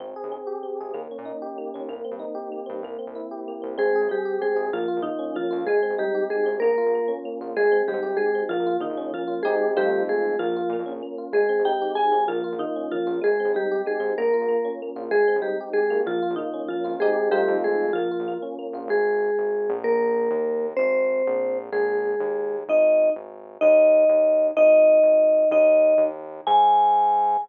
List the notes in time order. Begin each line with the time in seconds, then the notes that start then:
0.00 G#1 C4
0.16 G#4
0.24 D#2
0.32 C4
0.47 G4
0.63 C4
0.80 G#1 G#4
0.94 D#2 A#3
1.11 C#4
1.18 A#2
1.25 D#4
1.42 G4
1.58 A#3
1.74 D#2 C#4
1.88 C2 A#3
2.04 C4
2.11 G2
2.19 D#4
2.35 G4
2.52 A#3
2.66 G2 C4
2.83 C2 A#3
2.99 C4
3.07 C2
3.15 E4
3.31 G4
3.48 A#3
3.62 C2 C4
3.77 G#1 G#3 C4 G#4
3.95 G#4
4.01 G#1
4.09 G3 C4 G4
4.25 G4
4.42 G#3 C4 G#4
4.56 G#1 G#4
4.72 A#1 F3 A#3 F4
4.88 F4
4.96 A#1
5.02 D#3 A#3 D#4
5.19 C#4
5.35 F3 A#3 F4
5.50 F2 F4
5.67 G#1 G#3 G#4
5.82 C4
5.90 G#1
5.98 G3 D#4 G4
6.15 G4
6.30 G#3 G#4
6.46 G#1 C4
6.60 A#1 A#3 A#4
6.78 F4
6.86 A#1
6.95 A#3
7.08 C#4
7.25 A#3
7.40 A#1 F4
7.56 G#1 G#3 G#4
7.64 G#1
7.72 C4
7.88 D#2 G3 D#4 G4
7.94 G#2
8.02 G#1 G4
8.17 G#3 G#4
8.35 C4
8.49 A#1 F3 A#3 F4
8.59 A#1
8.66 F4
8.80 A#1 D#3 A#3 D#4
8.90 A#1
8.97 A#1 C#4
9.14 F3 A#3 F4
9.27 F4
9.43 G#1 G#3 C4 D#4 G4 G#4
9.76 F2 G3 A3 C4 D#4 F4 G4
10.09 G#3 G#4
10.39 A#1 F3 A#3 F4
10.48 A#1
10.56 F4
10.70 A#2 A#3
10.79 F2
10.86 A#1 C#4
11.02 A#3
11.18 F4
11.32 G#1 G#3 G#4
11.49 C4
11.59 G#1
11.65 D#4 G4 G5
11.82 G4
11.95 G#3 G#4 G#5
12.12 G#1 C4
12.28 A#1 F3 A#3 F4
12.44 F4
12.52 A#1
12.59 D#3 A#3 D#4
12.76 C#4
12.92 F3 A#3 F4
13.06 A#1 F4
13.21 G#1 G#3 G#4
13.40 C4
13.45 D#2
13.54 G3 D#4 G4
13.71 G4
13.86 G#3 G#4
14.00 G#2 C4
14.18 A#1 A#3 A#4
14.33 F4
14.42 A#1
14.48 A#3
14.65 C#4
14.82 A#3
14.96 A#1 F4
15.11 G#1 G#3 G#4
15.28 C4
15.36 D#2
15.42 G3 D#4 G4
15.60 G4
15.73 G#3 G#4
15.90 G#1 A#3
16.06 A#1 F3 F4
16.22 F4
16.30 A#1
16.36 D#3 A#3 D#4
16.53 C#4
16.68 F3 A#3 F4
16.84 G#1 F4
17.00 G#3 C4 D#4 G4 G#4
17.31 G3 A3 C4 D#4 F4 G4
17.48 F2
17.64 G#3 G#4
17.93 A#1 F3 A#3 F4
18.11 F4
18.20 A#1
18.28 A#3
18.42 C#4
18.59 A#3
18.73 A#1 F4
18.88 G#1 G#3 G#4
19.38 G#1
19.70 A#1
19.84 A#3 A#4
20.31 D#2
20.77 G#1 C4 C5
21.27 A#1
21.72 A#1 G#3 G#4
22.20 D#2
22.68 G#1 D#4 D#5
23.16 G#1
23.61 D#2 D#4 D#5
24.09 D#2
24.57 G#1 D#4 D#5
25.02 G#1
25.51 D#2 D#4 D#5
25.98 D#2
26.47 G#2 G#5